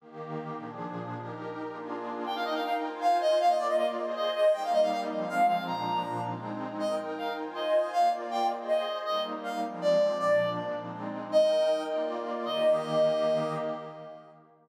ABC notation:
X:1
M:6/8
L:1/16
Q:3/8=106
K:Eb
V:1 name="Clarinet"
z12 | z12 | g f e f f z3 f2 e2 | f e d e e z3 e2 e2 |
g f e f f z3 f2 f2 | b6 z6 | e2 z2 f2 z2 e4 | f2 z2 g2 z2 e4 |
e2 z2 f2 z2 d4 | d4 z8 | e6 z6 | e12 |]
V:2 name="Pad 2 (warm)"
[E,B,G]6 [B,,F,DA]6 | [EGB]6 [B,DFA]6 | [EBg]6 [Fca]6 | [B,Fd]6 [Ace]6 |
[G,B,E]6 [F,A,C]6 | [B,,F,D]6 [A,CE]6 | [EBg]6 [Fca]6 | [B,Fd]6 [Ace]6 |
[G,B,E]6 [F,A,C]6 | [B,,F,D]6 [A,CE]6 | [EBg]6 [B,Fd]6 | [E,B,G]12 |]